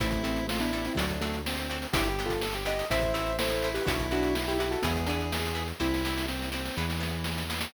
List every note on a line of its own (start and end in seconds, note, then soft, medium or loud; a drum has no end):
0.00 0.89 A1 medium
0.00 0.22 A3 medium
0.00 0.22 C4 medium
0.00 0.09 C4 medium
0.00 0.47 E4 medium
0.00 0.09 E4 medium
0.00 0.09 A4 medium
0.00 kick loud
0.00 closed hi-hat loud
0.10 kick loud
0.10 snare medium
0.10 closed hi-hat medium
0.23 0.44 A3 medium
0.23 0.44 C4 medium
0.23 0.41 C4 medium
0.23 0.41 E4 medium
0.23 0.41 A4 medium
0.23 closed hi-hat medium
0.36 closed hi-hat medium
0.48 0.59 A3 medium
0.48 0.59 C4 medium
0.48 0.61 F4 medium
0.48 snare loud
0.59 0.71 B3 medium
0.59 0.71 D4 medium
0.59 0.93 E4 medium
0.59 snare medium
0.59 closed hi-hat medium
0.73 0.86 B3 medium
0.73 0.81 C4 medium
0.73 0.86 D4 medium
0.73 0.81 E4 medium
0.73 0.81 A4 medium
0.73 closed hi-hat medium
0.85 0.98 C4 medium
0.85 0.98 E4 medium
0.85 closed hi-hat medium
0.95 1.86 D2 medium
0.95 1.17 D3 medium
0.95 1.17 F#3 medium
0.95 1.06 C4 medium
0.95 1.37 D4 medium
0.95 1.06 D4 medium
0.95 1.06 F#4 medium
0.95 1.06 A4 medium
0.95 kick medium
0.95 closed hi-hat loud
1.09 kick medium
1.09 closed hi-hat medium
1.21 1.41 F#3 medium
1.21 1.41 A3 medium
1.21 1.39 C4 medium
1.21 1.39 D4 medium
1.21 1.39 F#4 medium
1.21 1.39 A4 medium
1.21 closed hi-hat loud
1.31 snare soft
1.31 closed hi-hat medium
1.46 1.87 C4 medium
1.46 snare loud
1.57 closed hi-hat medium
1.70 1.79 C4 medium
1.70 1.79 D4 medium
1.70 1.79 F#4 medium
1.70 1.79 A4 medium
1.70 closed hi-hat medium
1.82 closed hi-hat medium
1.93 2.83 G1 medium
1.93 2.03 B3 loud
1.93 2.03 D4 medium
1.93 2.08 E4 medium
1.93 2.33 G4 medium
1.93 2.08 G4 medium
1.93 2.03 G4 medium
1.93 kick loud
1.93 closed hi-hat loud
2.04 closed hi-hat medium
2.09 2.24 E4 medium
2.09 2.24 G4 medium
2.19 2.37 B3 medium
2.19 2.37 D4 medium
2.19 2.37 G4 medium
2.19 closed hi-hat medium
2.26 2.41 F4 medium
2.26 2.41 A4 medium
2.26 kick medium
2.30 closed hi-hat medium
2.41 2.54 A4 medium
2.41 snare loud
2.53 2.85 G4 medium
2.53 snare medium
2.53 closed hi-hat medium
2.66 2.74 B3 medium
2.66 2.74 D4 medium
2.66 2.74 G4 medium
2.66 2.88 D#5 medium
2.66 snare soft
2.66 closed hi-hat loud
2.79 closed hi-hat medium
2.90 3.79 A1 medium
2.90 3.00 A3 medium
2.90 3.00 C4 loud
2.90 3.33 E4 medium
2.90 3.00 E4 loud
2.90 3.13 C5 medium
2.90 3.13 E5 medium
2.90 kick loud
2.90 closed hi-hat loud
3.01 kick loud
3.01 closed hi-hat medium
3.14 3.31 A3 medium
3.14 3.31 C4 medium
3.14 3.31 E4 medium
3.14 3.36 C5 medium
3.14 3.36 E5 medium
3.14 closed hi-hat loud
3.26 closed hi-hat medium
3.39 3.83 E4 medium
3.39 3.69 A4 medium
3.39 3.69 C5 medium
3.39 snare loud
3.49 closed hi-hat medium
3.62 3.73 A3 medium
3.62 3.73 C4 medium
3.62 3.73 E4 medium
3.62 closed hi-hat medium
3.74 3.86 G4 medium
3.74 3.86 B4 medium
3.74 closed hi-hat loud
3.85 4.76 B1 loud
3.85 3.96 B3 medium
3.85 4.06 D4 medium
3.85 4.53 E4 medium
3.85 3.96 E4 medium
3.85 4.06 F#4 medium
3.85 3.96 F#4 medium
3.85 kick loud
3.85 closed hi-hat loud
3.99 kick loud
3.99 closed hi-hat medium
4.11 4.29 B3 medium
4.11 4.34 D4 medium
4.11 4.29 E4 medium
4.11 4.29 F#4 medium
4.11 4.34 F#4 medium
4.11 closed hi-hat medium
4.23 closed hi-hat medium
4.34 4.46 D4 medium
4.34 4.46 F#4 medium
4.34 snare loud
4.47 4.59 E4 medium
4.47 4.59 G4 medium
4.47 snare medium
4.47 closed hi-hat medium
4.59 4.69 B3 medium
4.59 4.79 E4 medium
4.59 4.72 E4 medium
4.59 4.69 E4 medium
4.59 4.69 F#4 medium
4.59 4.72 G4 medium
4.59 closed hi-hat medium
4.71 4.83 F#4 medium
4.71 4.83 A4 medium
4.71 closed hi-hat medium
4.82 5.73 E2 loud
4.82 5.05 G#3 medium
4.82 5.05 B3 medium
4.82 4.93 B3 medium
4.82 4.93 E4 medium
4.82 5.68 G#4 medium
4.82 4.93 G#4 loud
4.82 kick loud
4.82 closed hi-hat loud
4.95 kick medium
4.95 closed hi-hat medium
5.06 5.31 B3 medium
5.06 5.26 B3 medium
5.06 5.31 D4 medium
5.06 5.26 E4 medium
5.06 5.26 G#4 medium
5.06 closed hi-hat loud
5.21 closed hi-hat medium
5.32 snare loud
5.45 closed hi-hat medium
5.55 5.63 B3 medium
5.55 5.63 E4 medium
5.55 5.63 G#4 medium
5.55 closed hi-hat medium
5.68 closed hi-hat medium
5.80 6.70 C2 medium
5.80 5.88 C4 medium
5.80 6.27 C4 medium
5.80 5.88 E4 medium
5.80 6.26 E4 medium
5.80 6.27 E4 medium
5.80 5.88 G4 medium
5.80 kick medium
5.80 snare loud
5.94 snare medium
6.05 6.22 C4 medium
6.05 6.22 E4 medium
6.05 6.22 G4 medium
6.05 snare loud
6.18 snare loud
6.28 6.50 C4 medium
6.28 snare loud
6.42 snare medium
6.52 6.61 C4 medium
6.52 6.76 C4 medium
6.52 6.61 E4 medium
6.52 6.61 G4 medium
6.52 snare loud
6.65 snare medium
6.76 7.66 E2 loud
6.76 7.44 E3 medium
6.76 6.86 B3 medium
6.76 6.86 E4 medium
6.76 6.86 G#4 medium
6.76 snare medium
6.90 snare loud
7.00 7.17 B3 medium
7.00 7.17 E4 medium
7.00 7.17 G#4 medium
7.00 snare medium
7.24 snare loud
7.38 snare loud
7.50 7.59 B3 medium
7.50 7.59 E4 medium
7.50 7.59 G#4 medium
7.50 snare loud
7.61 snare loud